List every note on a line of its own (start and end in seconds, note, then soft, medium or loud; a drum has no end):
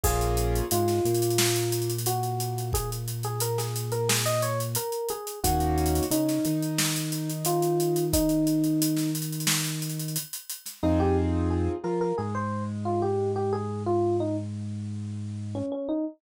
0.04 0.62 A#1 loud
0.04 0.64 A#3 loud
0.04 0.64 C#4 loud
0.04 0.64 F4 loud
0.04 0.64 G#4 loud
0.04 0.59 G#4 medium
0.04 kick loud
0.04 crash loud
0.21 closed hi-hat medium
0.37 closed hi-hat loud
0.55 closed hi-hat loud
0.71 1.00 G#2 loud
0.71 1.01 G#3 medium
0.71 1.91 F4 medium
0.71 closed hi-hat loud
0.88 snare medium
0.88 closed hi-hat medium
1.05 4.77 A#2 medium
1.05 4.78 A#3 medium
1.05 closed hi-hat loud
1.15 closed hi-hat loud
1.22 closed hi-hat loud
1.30 closed hi-hat loud
1.38 snare loud
1.56 closed hi-hat loud
1.72 closed hi-hat loud
1.82 closed hi-hat medium
1.90 closed hi-hat loud
1.98 closed hi-hat loud
2.06 2.65 F#4 medium
2.06 closed hi-hat loud
2.23 closed hi-hat medium
2.40 closed hi-hat loud
2.58 closed hi-hat medium
2.73 2.90 G#4 medium
2.73 kick loud
2.73 closed hi-hat loud
2.92 closed hi-hat loud
3.08 closed hi-hat loud
3.23 3.41 G#4 medium
3.23 closed hi-hat medium
3.40 3.57 A#4 medium
3.40 closed hi-hat loud
3.58 3.91 G#4 medium
3.58 snare medium
3.58 closed hi-hat loud
3.76 closed hi-hat loud
3.92 4.08 A#4 medium
3.92 closed hi-hat medium
4.09 4.25 G#4 medium
4.09 snare loud
4.26 4.42 D#5 medium
4.26 closed hi-hat loud
4.42 4.59 C#5 medium
4.42 closed hi-hat loud
4.60 closed hi-hat loud
4.75 5.09 A#4 medium
4.75 closed hi-hat loud
4.92 closed hi-hat medium
5.09 5.40 G#4 medium
5.09 closed hi-hat loud
5.27 closed hi-hat loud
5.44 6.01 D#2 loud
5.44 6.04 A#3 loud
5.44 6.04 C#4 loud
5.44 6.04 D#4 medium
5.44 6.02 F#4 medium
5.44 6.04 F#4 loud
5.44 kick loud
5.44 closed hi-hat loud
5.60 closed hi-hat medium
5.78 closed hi-hat medium
5.86 closed hi-hat loud
5.95 closed hi-hat loud
6.03 closed hi-hat loud
6.11 6.39 C#3 medium
6.11 6.40 C#4 medium
6.11 7.30 D#4 medium
6.11 closed hi-hat loud
6.29 snare medium
6.29 closed hi-hat medium
6.45 10.18 D#3 medium
6.45 10.18 D#4 medium
6.45 closed hi-hat loud
6.62 closed hi-hat medium
6.78 snare loud
6.96 closed hi-hat loud
7.12 closed hi-hat loud
7.30 closed hi-hat loud
7.45 8.04 F4 medium
7.45 closed hi-hat loud
7.62 closed hi-hat loud
7.80 closed hi-hat loud
7.96 closed hi-hat loud
8.13 9.10 D#4 medium
8.13 kick loud
8.13 closed hi-hat loud
8.29 closed hi-hat medium
8.47 closed hi-hat loud
8.64 closed hi-hat medium
8.82 closed hi-hat loud
8.96 snare medium
8.96 closed hi-hat medium
9.15 closed hi-hat loud
9.22 closed hi-hat loud
9.32 closed hi-hat medium
9.40 closed hi-hat loud
9.47 snare loud
9.65 closed hi-hat medium
9.82 closed hi-hat loud
9.90 closed hi-hat medium
10.00 closed hi-hat loud
10.08 closed hi-hat medium
10.16 closed hi-hat loud
10.33 closed hi-hat loud
10.50 closed hi-hat loud
10.66 snare soft
10.66 closed hi-hat loud
10.83 11.69 F2 loud
10.83 11.74 C4 medium
10.83 11.74 D#4 medium
10.83 10.99 D#4 medium
10.83 11.74 F4 medium
10.83 11.74 G#4 medium
11.00 11.16 G4 medium
11.50 11.78 G#4 medium
11.84 12.13 F3 medium
11.84 12.12 F4 medium
11.84 12.00 A#4 medium
12.01 12.17 A#4 medium
12.18 15.62 G#2 medium
12.18 15.61 G#3 medium
12.18 12.34 G#4 medium
12.35 12.63 C5 medium
12.85 13.01 F4 medium
13.02 13.30 G4 medium
13.36 13.52 G4 medium
13.53 13.83 G#4 medium
13.86 14.16 F4 medium
14.20 14.36 D#4 medium
15.55 15.71 C#4 medium
15.72 15.88 C#4 medium
15.89 16.05 D#4 medium